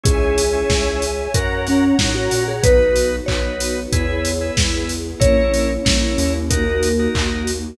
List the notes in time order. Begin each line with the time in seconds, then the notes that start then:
0.03 C#2 C#4 E4 G#4 C#5 E5 G#5, kick, closed hi-hat
0.38 open hi-hat
0.53 C#4 E4 G#4
0.70 C#2, kick, snare
1.02 open hi-hat
1.34 F#2 C#4 F#4 A#4 C#5 F#5 A#5, kick, closed hi-hat
1.67 C#4, open hi-hat
1.99 A2 C#4 D#4 F#4 A#4, kick, snare
2.15 F#4
2.31 A#2, open hi-hat
2.48 G#4
2.63 B1 B3 D#4 F#4 B4, kick, closed hi-hat
2.96 open hi-hat
3.26 B1 D#4 F#4 B4 C#5, kick, clap
3.60 open hi-hat
3.92 E2 B3 E4 G#4 B4, kick, closed hi-hat
4.25 open hi-hat
4.41 E4 G#4 B4
4.57 E2, kick, snare
4.89 open hi-hat
5.20 A#1 A#3 C#4 E4 A#4 C#5, kick, closed hi-hat
5.54 open hi-hat
5.85 A#1 E4 A#4 C#5, kick, snare
6.18 D#2, open hi-hat
6.50 A#3 D#4 F#4 A#4, kick, closed hi-hat
6.83 open hi-hat
6.99 D#4 F#4 A#4
7.15 D#2, kick, clap
7.47 open hi-hat